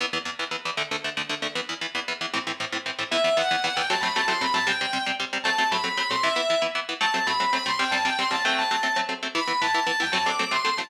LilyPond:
<<
  \new Staff \with { instrumentName = "Distortion Guitar" } { \time 6/8 \key e \minor \tempo 4. = 154 r2. | r2. | r2. | r2. |
e''4 fis''4 fis''8 g''8 | a''8 b''8 a''8 c'''8 b''8 a''8 | g''4. r4. | a''4 b''4 b''8 c'''8 |
e''4. r4. | a''4 b''4 b''8 c'''8 | g''8 a''8 g''8 c'''8 a''8 g''8 | a''4. r4. |
b''4 a''4 a''8 g''8 | a''8 d'''4 c'''4 a''8 | }
  \new Staff \with { instrumentName = "Overdriven Guitar" } { \time 6/8 \key e \minor <e, e b>8 <e, e b>8 <e, e b>8 <e, e b>8 <e, e b>8 <e, e b>8 | <d, d a>8 <d, d a>8 <d, d a>8 <d, d a>8 <d, d a>8 <d, d a>8 | <e, e b>8 <e, e b>8 <e, e b>8 <e, e b>8 <e, e b>8 <e, e b>8 | <a, e c'>8 <a, e c'>8 <a, e c'>8 <a, e c'>8 <a, e c'>8 <a, e c'>8 |
<e, e b>8 <e, e b>8 <e, e b>8 <e, e b>8 <e, e b>8 <e, e b>8 | <fis a c'>8 <fis a c'>8 <fis a c'>8 <fis a c'>8 <fis a c'>8 <fis a c'>8 | <c g c'>8 <c g c'>8 <c g c'>8 <c g c'>8 <c g c'>8 <c g c'>8 | <fis a c'>8 <fis a c'>8 <fis a c'>8 <fis a c'>8 <fis a c'>8 <fis a c'>8 |
<e b e'>8 <e b e'>8 <e b e'>8 <e b e'>8 <e b e'>8 <e b e'>8 | <fis a c'>8 <fis a c'>8 <fis a c'>8 <fis a c'>8 <fis a c'>8 <fis a c'>8 | <c g c'>8 <c g c'>8 <c g c'>8 <c g c'>8 <c g c'>8 <fis a c'>8~ | <fis a c'>8 <fis a c'>8 <fis a c'>8 <fis a c'>8 <fis a c'>8 <fis a c'>8 |
<e b e'>8 <e b e'>8 <e b e'>8 <e b e'>8 <e b e'>8 <e b e'>8 | <fis a c'>8 <fis a c'>8 <fis a c'>8 <fis a c'>8 <fis a c'>8 <fis a c'>8 | }
>>